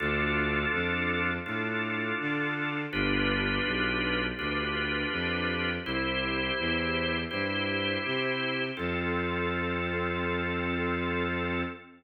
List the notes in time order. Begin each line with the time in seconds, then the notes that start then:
0.00 D2 D4 F4 A4
0.73 F2
1.46 A2 D4 F4 A4
2.20 D3
2.93 G1 D4 F4 G4 B4
3.66 B1
4.39 D2 D4 F4 G4 B4
5.12 F2
5.85 C2 E4 G4 C5
6.59 E2
7.31 G2 E4 G4 C5
8.05 C3
8.77 F2 C4 F4 A4